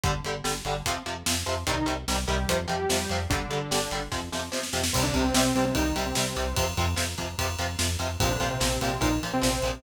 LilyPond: <<
  \new Staff \with { instrumentName = "Lead 2 (sawtooth)" } { \time 4/4 \key c \dorian \tempo 4 = 147 r1 | <ees ees'>8 r4 <g g'>8. r16 <g g'>4. | <d d'>2 r2 | <c c'>16 <d d'>16 <c c'>16 <c c'>16 <c c'>8 <c c'>16 <c c'>16 <ees ees'>8 r16 <c c'>16 <c c'>4 |
r1 | <c c'>16 <d d'>16 <c c'>16 <c c'>16 <c c'>8 <c c'>16 <c c'>16 <ees ees'>8 r16 <c c'>16 <c c'>4 | }
  \new Staff \with { instrumentName = "Overdriven Guitar" } { \clef bass \time 4/4 \key c \dorian <d g>8 <d g>8 <d g>8 <d g>8 <c f>8 <c f>8 <c f>8 <c f>8 | <c ees g>8 <c ees g>8 <c ees g>8 <c ees g>8 <c f>8 <c f>8 <c f>8 <c f>8 | <d g>8 <d g>8 <d g>8 <d g>8 <c f>8 <c f>8 <c f>8 <c f>8 | <c g>8 <c g>8 <c g>8 <c g>8 <c g>8 <c g>8 <c g>8 <c g>8 |
<c f>8 <c f>8 <c f>8 <c f>8 <c f>8 <c f>8 <c f>8 <c f>8 | <bes, f>8 <bes, f>8 <bes, f>8 <bes, f>8 <bes, f>8 <bes, f>8 <bes, f>8 <bes, f>8 | }
  \new Staff \with { instrumentName = "Synth Bass 1" } { \clef bass \time 4/4 \key c \dorian g,,8 g,,8 g,,8 g,,8 f,8 f,8 f,8 f,8 | c,8 c,8 c,8 c,8 f,8 f,8 f,8 f,8 | g,,8 g,,8 g,,8 g,,8 f,8 f,8 f,8 f,8 | c,8 c,8 c,8 c,8 c,8 c,8 c,8 c,8 |
f,8 f,8 f,8 f,8 f,8 f,8 f,8 f,8 | bes,,8 bes,,8 bes,,8 bes,,8 bes,,8 bes,,8 bes,,8 bes,,8 | }
  \new DrumStaff \with { instrumentName = "Drums" } \drummode { \time 4/4 <hh bd>8 hh8 sn8 hh8 <hh bd>8 hh8 sn8 hh8 | <hh bd>8 hh8 sn8 hh8 <hh bd>8 hh8 sn8 hh8 | <hh bd>8 hh8 sn8 hh8 <bd sn>8 sn8 sn16 sn16 sn16 sn16 | <cymc bd>8 <bd cymr>8 sn8 cymr8 <bd cymr>8 cymr8 sn8 cymr8 |
<bd cymr>8 <bd cymr>8 sn8 <bd cymr>8 <bd cymr>8 cymr8 sn8 cymr8 | <bd cymr>8 <bd cymr>8 sn8 cymr8 <bd cymr>8 cymr8 sn8 cymr8 | }
>>